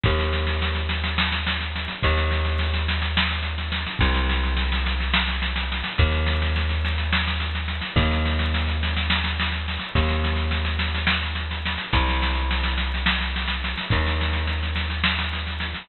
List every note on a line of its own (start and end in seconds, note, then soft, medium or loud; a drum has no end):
0.04 1.88 D#2 medium
0.04 kick medium
0.04 snare medium
0.19 snare medium
0.33 snare medium
0.47 snare medium
0.62 snare medium
0.75 snare medium
0.89 snare medium
1.04 snare medium
1.18 snare medium
1.32 snare medium
1.46 snare medium
1.60 snare medium
1.75 snare medium
1.88 snare medium
2.02 3.86 D#2 medium
2.02 kick medium
2.02 snare medium
2.17 snare medium
2.31 snare medium
2.45 snare medium
2.59 snare medium
2.73 snare medium
2.88 snare medium
3.02 snare medium
3.17 snare loud
3.31 snare medium
3.42 snare medium
3.58 snare medium
3.72 snare medium
3.86 snare medium
3.99 5.83 C2 medium
3.99 kick medium
3.99 snare medium
4.14 snare medium
4.29 snare medium
4.43 snare medium
4.56 snare medium
4.72 snare medium
4.86 snare medium
5.00 snare medium
5.14 snare loud
5.28 snare medium
5.42 snare medium
5.56 snare medium
5.72 snare medium
5.84 snare medium
5.98 7.81 D#2 medium
5.98 kick medium
5.98 snare medium
6.11 snare medium
6.26 snare medium
6.42 snare medium
6.56 snare medium
6.69 snare medium
6.85 snare medium
6.98 snare medium
7.13 snare medium
7.27 snare medium
7.40 snare medium
7.55 snare medium
7.68 snare medium
7.81 snare medium
7.96 9.78 D#2 medium
7.96 kick medium
7.96 snare medium
8.11 snare medium
8.25 snare medium
8.39 snare medium
8.54 snare medium
8.68 snare medium
8.83 snare medium
8.96 snare medium
9.10 snare medium
9.24 snare medium
9.40 snare medium
9.52 snare medium
9.68 snare medium
9.79 snare medium
9.95 11.77 D#2 medium
9.95 kick medium
9.95 snare medium
10.09 snare medium
10.24 snare medium
10.36 snare medium
10.51 snare medium
10.65 snare medium
10.79 snare medium
10.94 snare medium
11.07 snare loud
11.23 snare medium
11.35 snare medium
11.51 snare medium
11.65 snare medium
11.78 snare medium
11.93 13.75 C2 medium
11.93 kick medium
11.93 snare medium
12.08 snare medium
12.22 snare medium
12.35 snare medium
12.51 snare medium
12.63 snare medium
12.78 snare medium
12.94 snare medium
13.06 snare loud
13.21 snare medium
13.36 snare medium
13.48 snare medium
13.64 snare medium
13.77 snare medium
13.90 15.74 D#2 medium
13.90 kick medium
13.90 snare medium
14.06 snare medium
14.21 snare medium
14.33 snare medium
14.47 snare medium
14.63 snare medium
14.76 snare medium
14.90 snare medium
15.04 snare medium
15.19 snare medium
15.33 snare medium
15.47 snare medium
15.60 snare medium
15.74 snare medium